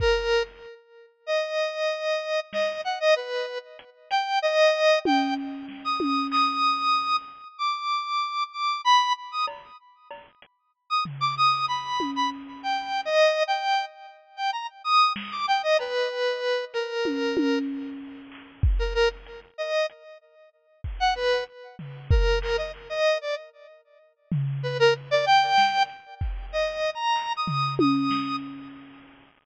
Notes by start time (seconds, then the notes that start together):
0.00 A#4, kick
1.26 D#5
2.53 D#5, snare
2.84 F#5
3.00 D#5
3.16 B4
3.79 closed hi-hat
4.11 G5, closed hi-hat
4.42 D#5
5.05 G5, high tom
5.68 snare
5.84 D#6
6.00 high tom
6.31 D#6, clap
7.58 D6
8.53 D6
8.84 B5
9.32 D#6
9.47 cowbell
10.11 cowbell
10.42 closed hi-hat
10.90 D#6
11.05 floor tom
11.21 D6
11.37 D#6
11.68 B5
12.00 high tom
12.16 B5
12.63 G5
13.05 D#5
13.48 G5
14.36 G5
14.53 A#5
14.84 D#6
15.16 snare
15.32 D6
15.48 G5
15.63 D#5
15.79 B4, cowbell
16.74 A#4, closed hi-hat
17.05 high tom
17.37 high tom
18.32 clap
18.63 kick
18.79 A#4
18.94 A#4
19.26 closed hi-hat
19.58 D#5
19.89 closed hi-hat
20.84 kick
21.00 F#5
21.16 B4
21.79 floor tom
22.11 A#4, kick
22.42 A#4, clap
22.58 D#5
22.74 clap
22.90 D#5
23.21 D5
24.32 floor tom
24.63 B4
24.79 A#4
25.11 D5
25.26 G5
25.58 snare
25.89 closed hi-hat
26.21 kick
26.52 D#5
26.95 A#5
27.16 clap
27.37 D#6
27.47 floor tom
27.79 D#6, high tom
28.11 snare